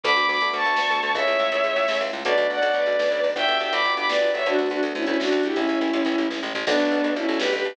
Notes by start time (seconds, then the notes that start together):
0.03 D2 A3 B3 D4 F#4 B5 D6, kick, closed hi-hat
0.11 closed hi-hat
0.16 D2, closed hi-hat
0.22 closed hi-hat
0.28 D2 B5 D6, closed hi-hat
0.34 closed hi-hat
0.41 D2 A3 B3 D4 F#4, closed hi-hat
0.48 closed hi-hat
0.53 D2 A5 C#6, closed hi-hat
0.60 closed hi-hat
0.65 D2, closed hi-hat
0.70 closed hi-hat
0.76 D2 A3 B3 D4 F#4, snare
0.85 closed hi-hat
0.90 D2, closed hi-hat
0.96 closed hi-hat
1.03 D2, closed hi-hat
1.09 closed hi-hat
1.14 C#2 G#3 A3 C#4 E4 C#5 E5, kick, closed hi-hat
1.19 closed hi-hat
1.27 C#2, closed hi-hat
1.33 closed hi-hat
1.39 C#2, closed hi-hat
1.45 closed hi-hat
1.52 C#2 G#3 A3 C#4 E4, closed hi-hat
1.57 closed hi-hat
1.64 C#2, closed hi-hat
1.71 closed hi-hat
1.76 C#2, closed hi-hat
1.83 closed hi-hat
1.88 C#2 G#3 A3 C#4 E4, snare
1.94 closed hi-hat
2.01 C#2, closed hi-hat
2.07 closed hi-hat
2.12 C#2, closed hi-hat
2.19 closed hi-hat
2.25 B1 A3 B3 D4 F#4 B4 D5, kick, closed hi-hat
2.30 closed hi-hat
2.37 B1, closed hi-hat
2.43 closed hi-hat
2.50 B1 D5 F#5, closed hi-hat
2.55 closed hi-hat
2.62 B1 A3 B3 D4 F#4, closed hi-hat
2.68 closed hi-hat
2.73 B1 B4 D5, closed hi-hat
2.79 closed hi-hat
2.86 B1, closed hi-hat
2.92 closed hi-hat
2.99 B1, snare
3.06 closed hi-hat
3.10 B1, closed hi-hat
3.17 closed hi-hat
3.23 B1, closed hi-hat
3.29 open hi-hat
3.35 G1 B3 D4 F#4 G4 E5 G5, kick, closed hi-hat
3.41 closed hi-hat
3.48 G1, closed hi-hat
3.54 closed hi-hat
3.60 G1 E5 G5, closed hi-hat
3.66 closed hi-hat
3.72 G1 B3 D4 F#4 G4 B5 D6, closed hi-hat
3.78 closed hi-hat
3.84 G1, closed hi-hat
3.90 closed hi-hat
3.97 G1 B5 D6, closed hi-hat
4.04 closed hi-hat
4.09 G1 B4 D5, snare
4.16 closed hi-hat
4.20 G1, closed hi-hat
4.28 closed hi-hat
4.34 G1 C#5 E5, closed hi-hat
4.40 closed hi-hat
4.45 D2 A3 B3 D4 F#4, kick, closed hi-hat
4.53 D4 F#4, closed hi-hat
4.58 D2, closed hi-hat
4.66 closed hi-hat
4.70 D2 D4 F#4, closed hi-hat
4.76 closed hi-hat
4.83 D2, closed hi-hat
4.88 closed hi-hat
4.95 D2 C#4 E4, closed hi-hat
5.02 C#4 E4, closed hi-hat
5.07 D2, closed hi-hat
5.14 closed hi-hat
5.20 D2 D4 F#4, snare
5.27 closed hi-hat
5.32 D2, closed hi-hat
5.40 closed hi-hat
5.43 D2 E4 G4, closed hi-hat
5.51 C#4 E4, closed hi-hat
5.56 A1 G#3 A3 C#4 E4, kick, closed hi-hat
5.61 closed hi-hat
5.67 A1, closed hi-hat
5.75 closed hi-hat
5.81 A1, closed hi-hat
5.88 closed hi-hat
5.93 A1, closed hi-hat
6.00 closed hi-hat
6.05 A1, closed hi-hat
6.12 closed hi-hat
6.18 A1, closed hi-hat
6.22 closed hi-hat
6.30 A1, kick, snare
6.43 A1
6.54 A1, floor tom
6.67 B1 A3 B3 D4 F#4, kick, crash
6.71 closed hi-hat
6.78 B1, closed hi-hat
6.85 closed hi-hat
6.91 B1, closed hi-hat
6.98 closed hi-hat
7.04 B1 A3 B3 D4 F#4, closed hi-hat
7.11 closed hi-hat
7.16 B1 C#4 E4, closed hi-hat
7.22 closed hi-hat
7.28 B1, closed hi-hat
7.34 closed hi-hat
7.39 B1 G4 B4, snare
7.47 closed hi-hat
7.52 B1 G4 B4, closed hi-hat
7.60 closed hi-hat
7.64 B1, closed hi-hat
7.70 closed hi-hat